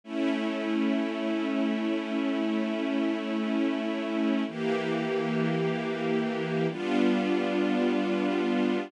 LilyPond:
\new Staff { \time 4/4 \key d \minor \tempo 4 = 54 <a cis' e'>1 | <e bes g'>2 <g b d' f'>2 | }